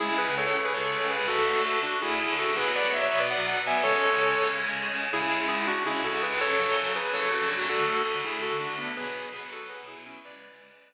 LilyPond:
<<
  \new Staff \with { instrumentName = "Distortion Guitar" } { \time 7/8 \key cis \phrygian \tempo 4 = 164 <e' gis'>8 <gis' b'>8 <a' cis''>16 <a' cis''>8 <gis' b'>16 <a' cis''>4 <gis' b'>8 | <fis' a'>4 <fis' a'>8 <d' fis'>8 <e' gis'>8 <e' gis'>8 <fis' a'>8 | <gis' b'>8 <b' d''>8 <cis'' e''>16 <cis'' e''>8 <b' d''>16 <d'' fis''>4 <e'' gis''>8 | <a' cis''>2 r4. |
<e' gis'>4 <e' gis'>8 <d' fis'>8 <e' gis'>8 <fis' a'>8 <gis' b'>8 | <a' cis''>4 <a' cis''>8 <gis' b'>8 <a' cis''>8 <fis' a'>8 <d' fis'>8 | <fis' a'>4 <fis' a'>8 <e' gis'>8 <fis' a'>8 <d' fis'>8 <b d'>8 | <gis' b'>4 <gis' b'>8 <fis' a'>8 <gis' b'>8 <e' gis'>8 <cis' e'>8 |
<b' d''>2 r4. | }
  \new Staff \with { instrumentName = "Overdriven Guitar" } { \time 7/8 \key cis \phrygian <cis, cis gis>16 <cis, cis gis>8 <cis, cis gis>4~ <cis, cis gis>16 <cis, cis gis>8. <cis, cis gis>8 <cis, cis gis>16 | <d, d a>16 <d, d a>8 <d, d a>4~ <d, d a>16 <d, d a>8. <d, d a>8 <d, d a>16 | <b, fis b>16 <b, fis b>8 <b, fis b>8. <b, fis b>8. <b, fis b>8. <b, fis b>8 | <cis gis cis'>16 <cis gis cis'>8 <cis gis cis'>8. <cis gis cis'>8. <cis gis cis'>8. <cis gis cis'>8 |
<cis, cis gis>16 <cis, cis gis>8 <cis, cis gis>4~ <cis, cis gis>16 <cis, cis gis>8. <cis, cis gis>8 <cis, cis gis>16 | <fis, cis fis>16 <fis, cis fis>8 <fis, cis fis>4~ <fis, cis fis>16 <fis, cis fis>8. <fis, cis fis>8 <fis, cis fis>16 | <d, d a>16 <d, d a>8. <d, d a>16 <d, d a>16 <d, d a>8. <d, d a>8 <d, d a>8. | <b, fis b>16 <b, fis b>8. <b, fis b>16 <b, fis b>16 <b, fis b>8. <b, fis b>8 <b, fis b>8. |
<cis, cis gis>8. <cis, cis gis>16 <cis, cis gis>16 <cis, cis gis>8 <cis, cis gis>8. r4 | }
>>